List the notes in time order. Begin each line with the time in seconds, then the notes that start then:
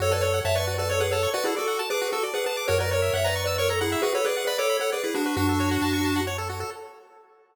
0.00 F#2 F#4 A4 C#5
0.11 A4 B4 D5
0.21 A4 C#5
0.34 F#5
0.45 F#2 C#5 E5 A5
0.55 B4 D5 C#6
0.67 F#4
0.78 A4 B4 D5
0.89 A4 C#5
1.00 G#4 B4 F#5
1.11 A4 C#5 A5
1.23 C#6
1.34 F#4 B4 D5
1.44 E4 G#4 A4
1.57 F#4 A4 D5
1.68 F#5
1.79 A5
1.90 G#4 B4 D6
2.01 F#4
2.12 F#4 A4
2.23 D5
2.34 G#4 B4 F#5
2.46 G#4 B4 A5
2.57 D6
2.68 F#2 F#4 A#4 C#5
2.80 A#4 B4 D5
2.91 A#4 C#5
3.02 E5
3.13 F#2 C#5 E5 F#5
3.24 B4 D5 A#5
3.36 C#6
3.46 B4 D5 E6
3.58 A#4 C#5 C#6
3.69 A4 A#5
3.81 E4 G#4 F#5
3.92 E5
4.02 F#4 G#4 B4
4.15 A4 B4 C#5
4.25 G#4 B4 D5
4.37 F#5
4.47 B4 D5 B5
4.58 A4 C#5 D6
4.69 B5
4.80 A4 C#5 F#5
4.92 G#4 B4 D5
5.04 E4 G#4 B4
5.15 D4 F#4
5.26 B4
5.36 F#2 D4 F#4
5.49 A4
5.60 C#5
5.71 F#5
5.82 F#2 A5
5.93 C#6
6.05 A5
6.16 F#5
6.27 C#5
6.38 A4
6.50 F#4
6.60 A4